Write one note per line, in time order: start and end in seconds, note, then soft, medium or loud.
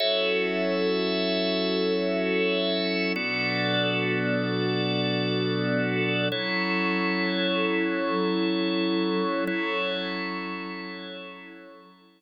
0.00 3.13 F#3 loud
0.00 3.13 C#4 medium
0.00 3.13 E4 loud
0.00 3.13 F#4 medium
0.00 3.13 A4 loud
0.00 3.13 A4 medium
0.00 3.13 C#5 medium
0.00 3.13 E5 medium
3.16 6.28 B2 loud
3.16 6.28 F#3 loud
3.16 6.28 B3 medium
3.16 6.28 D4 loud
3.16 6.28 F#4 medium
3.16 6.28 A4 loud
3.16 6.28 A4 medium
3.16 6.28 D5 medium
6.32 9.44 F#3 medium
6.32 9.45 F#3 loud
6.32 9.45 C#4 medium
6.32 9.44 E4 medium
6.32 9.45 E4 medium
6.32 9.44 A4 medium
6.32 9.45 A4 medium
6.32 9.44 C#5 medium
9.47 12.22 F#3 loud
9.47 12.22 F#3 medium
9.47 12.22 C#4 medium
9.47 12.22 E4 loud
9.47 12.22 E4 medium
9.47 12.22 A4 loud
9.47 12.22 A4 medium
9.47 12.22 C#5 medium